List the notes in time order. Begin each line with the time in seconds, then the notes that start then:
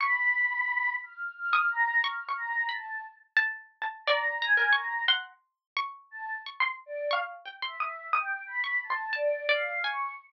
0.00 B5 C#6
1.03 F6
1.37 F6
1.53 C#6 D#6
1.71 A#5
2.04 C#6 F6
2.29 C#6
2.37 A#5
2.69 A5 B5
3.37 A5
3.82 A5
4.06 D5 A#5 C#6
4.42 G#5 A#5
4.57 A#4
4.73 A#5 C#6
5.08 F#5 C6
5.77 C#6
6.11 A5
6.46 C#6
6.60 C6
6.86 D5
7.11 F5 C#6
7.46 G5
7.62 E5 C6
7.80 D#6
8.13 G5 D#6
8.47 B5
8.64 C#6
8.83 A5
8.90 C6
9.13 D5 A5
9.49 D5 F5
9.82 G#5 C#6